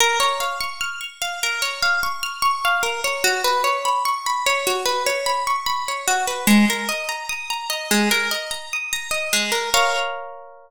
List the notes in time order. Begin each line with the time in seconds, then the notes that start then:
0.00 A#4
0.20 C#5
0.40 F5
0.60 C#6
0.81 F6
1.01 C#6
1.22 F5
1.43 A#4
1.62 C#5
1.82 F5
2.03 C#6
2.23 F6
2.42 C#6
2.65 F5
2.83 A#4
3.04 C#5
3.24 F#4
3.44 B4
3.64 C#5
3.85 B5
4.05 C#6
4.26 B5
4.46 C#5
4.67 F#4
4.85 B4
5.06 C#5
5.26 B5
5.47 C#6
5.66 B5
5.88 C#5
6.08 F#4
6.28 B4
6.47 G#3
6.70 A#4
6.89 D#5
7.09 A#5
7.29 D#6
7.50 A#5
7.70 D#5
7.91 G#3
8.11 A#4
8.31 D#5
8.51 A#5
8.73 D#6
8.93 A#5
9.11 D#5
9.33 G#3
9.52 A#4
9.74 A#4 C#5 F5